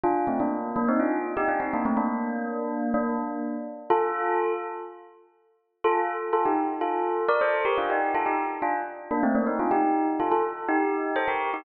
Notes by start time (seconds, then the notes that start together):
0.04 D4 F4
0.27 A3 C4
0.40 A#3 D4
0.76 A#3 D4
0.88 C4 D#4
1.00 D4 F4
1.37 D#4 G4
1.48 D4 F4
1.60 C4 D#4
1.73 A#3 D4
1.85 A3 C4
1.97 A#3 D4
2.94 A#3 D4
3.90 F4 A4
5.84 F4 A4
6.33 F4 A4
6.45 D#4 G4
6.81 F4 A4
7.29 A#4 D5
7.41 A4 C5
7.65 G4 A#4
7.78 D4 F4
7.90 D#4 G4
8.15 F4 A4
8.26 D#4 G4
8.62 D4 F4
9.11 A#3 D4
9.23 A3 C4
9.35 A#3 D4
9.47 C4 D#4
9.59 D4 F4
9.71 D#4 G4
10.20 F4 A4
10.32 F4 A4
10.69 D#4 G4
11.16 A4 C5
11.28 G4 A#4
11.54 D#4 G4